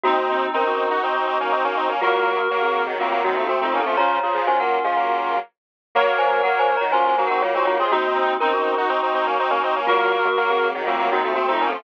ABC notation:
X:1
M:4/4
L:1/16
Q:1/4=122
K:Bbm
V:1 name="Glockenspiel"
[B,G]4 [DB]4 z8 | [A,F]3 [B,G] z [CA]3 [=A,F]2 [B,G]2 (3[B,G]2 [A,F]2 [C=A]2 | [db]4 [ca] [Bg]2 [Af]5 z4 | z2 [ca]2 (3[Bg]2 [ca]2 [db]2 (3[ca]2 [ca]2 [Bg]2 [Fd]2 [Fd]2 |
[B,G]4 [DB]4 z8 | [A,F]3 [B,G] z [CA]3 [=A,F]2 [B,G]2 (3[B,G]2 [A,F]2 [C=A]2 |]
V:2 name="Clarinet"
[CE] z [CE]2 [CE] [EG]11 | [GB]8 [=A,C]2 [CE] [CE] z [CE]2 [DF] | [DF]2 [FA]2 [DF]8 z4 | [Bd]8 [DF]2 [EG] [EG] z [EG]2 [FA] |
[CE] z [CE]2 [CE] [EG]11 | [GB]8 [=A,C]2 [CE] [CE] z [CE]2 [DF] |]
V:3 name="Lead 1 (square)"
[CE]4 [CE]3 [EG] [CE] [CE] [CE] [B,D] [CE] [B,D] [CE] [B,D] | [G,B,]4 [G,B,]3 [E,G,] [G,B,] [G,B,] [E,G,] [F,=A,] [A,C] [A,C] [B,D] [F,A,] | [D,F,]2 [D,F,] [D,F,] [E,G,] [G,B,]2 [F,A,] [G,B,]4 z4 | [G,B,]4 [G,B,]3 [E,G,] [G,B,] [G,B,] [G,B,] [A,C] [G,B,] [A,C] [G,B,] [A,C] |
[CE]4 [CE]3 [EG] [CE] [CE] [CE] [B,D] [CE] [B,D] [CE] [B,D] | [G,B,]4 [G,B,]3 [E,G,] [G,B,] [G,B,] [E,G,] [F,=A,] [A,C] [A,C] [B,D] [F,A,] |]